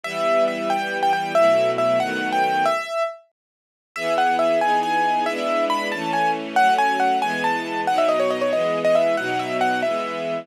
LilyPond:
<<
  \new Staff \with { instrumentName = "Acoustic Grand Piano" } { \time 6/8 \key e \minor \tempo 4. = 92 e''4 e''8 g''8. g''16 g''8 | e''4 e''8 fis''8. g''16 g''8 | e''4 r2 | \key e \major e''8 fis''8 e''8 gis''8 gis''4 |
e''4 b''8 a''8 gis''8 r8 | fis''8 gis''8 fis''8 gis''8 a''4 | fis''16 e''16 dis''16 cis''16 dis''16 cis''16 dis''8. dis''16 e''8 | fis''8 e''8 fis''8 e''4. | }
  \new Staff \with { instrumentName = "String Ensemble 1" } { \time 6/8 \key e \minor <e g b>2. | <b, fis a e'>4. <dis fis a b>4. | r2. | \key e \major <e b gis'>4. <e b dis' gis'>4. |
<gis b d' e'>4. <e a cis'>4. | <fis a cis'>4. <e gis b>4. | <b, fis dis'>4. <e gis b>4. | <b, fis dis'>4. <e gis b>4. | }
>>